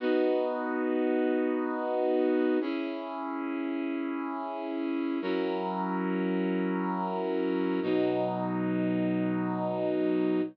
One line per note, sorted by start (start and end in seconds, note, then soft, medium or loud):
0.00 2.58 B3 medium
0.00 2.58 D#4 medium
0.00 2.58 F#4 medium
2.61 5.19 C#4 medium
2.61 5.19 E4 medium
2.61 5.19 G#4 medium
5.22 7.80 F#3 medium
5.22 7.80 C#4 medium
5.22 7.80 E4 medium
5.22 7.80 A#4 medium
7.82 10.41 B2 medium
7.82 10.41 F#3 medium
7.82 10.41 D#4 medium